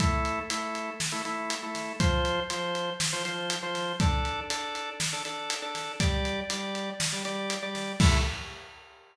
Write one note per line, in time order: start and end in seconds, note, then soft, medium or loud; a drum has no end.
0.00 0.40 A3 medium
0.00 0.40 E4 medium
0.00 0.40 A4 loud
0.00 kick medium
0.00 closed hi-hat medium
0.25 closed hi-hat medium
0.50 0.90 A3 medium
0.50 0.90 E4 medium
0.50 0.90 A4 medium
0.50 closed hi-hat medium
0.75 closed hi-hat medium
1.00 snare medium
1.12 1.22 A3 medium
1.12 1.22 E4 medium
1.12 1.22 A4 medium
1.25 1.55 A3 medium
1.25 1.55 E4 medium
1.25 1.55 A4 medium
1.25 closed hi-hat medium
1.50 closed hi-hat medium
1.63 1.93 A3 medium
1.63 1.93 E4 medium
1.63 1.93 A4 medium
1.75 snare soft
1.75 closed hi-hat medium
2.00 2.40 F3 medium
2.00 2.40 F4 medium
2.00 2.40 C5 medium
2.00 kick medium
2.00 closed hi-hat medium
2.25 closed hi-hat medium
2.50 2.90 F3 medium
2.50 2.90 F4 medium
2.50 2.90 C5 medium
2.50 closed hi-hat medium
2.75 closed hi-hat medium
3.00 snare medium
3.13 3.23 F3 medium
3.13 3.23 F4 medium
3.13 3.23 C5 medium
3.25 3.55 F3 medium
3.25 3.55 F4 medium
3.25 3.55 C5 medium
3.25 closed hi-hat medium
3.50 closed hi-hat medium
3.63 3.93 F3 medium
3.63 3.93 F4 medium
3.63 3.93 C5 medium
3.75 snare soft
3.75 closed hi-hat medium
4.00 4.40 D4 loud
4.00 4.40 A4 medium
4.00 4.40 D5 medium
4.00 kick medium
4.00 closed hi-hat medium
4.25 closed hi-hat medium
4.50 4.90 D4 medium
4.50 4.90 A4 medium
4.50 4.90 D5 medium
4.50 closed hi-hat medium
4.75 closed hi-hat medium
5.00 snare medium
5.13 5.23 D4 medium
5.13 5.23 A4 medium
5.13 5.23 D5 medium
5.25 5.55 D4 medium
5.25 5.55 A4 medium
5.25 5.55 D5 medium
5.25 closed hi-hat medium
5.50 closed hi-hat medium
5.62 5.92 D4 medium
5.62 5.92 A4 medium
5.62 5.92 D5 medium
5.75 snare soft
5.75 closed hi-hat medium
6.00 6.40 G3 medium
6.00 6.40 G4 medium
6.00 6.40 D5 loud
6.00 kick medium
6.00 closed hi-hat medium
6.25 closed hi-hat medium
6.50 6.90 G3 medium
6.50 6.90 G4 medium
6.50 6.90 D5 medium
6.50 closed hi-hat medium
6.75 closed hi-hat medium
7.00 snare medium
7.12 7.22 G3 medium
7.12 7.22 G4 medium
7.12 7.22 D5 medium
7.25 7.55 G3 medium
7.25 7.55 G4 medium
7.25 7.55 D5 medium
7.25 closed hi-hat medium
7.50 closed hi-hat medium
7.62 7.92 G3 medium
7.62 7.92 G4 medium
7.62 7.92 D5 medium
7.75 snare soft
7.75 closed hi-hat soft
8.00 8.18 A3 medium
8.00 8.18 E4 loud
8.00 8.18 A4 loud
8.00 kick loud
8.00 crash loud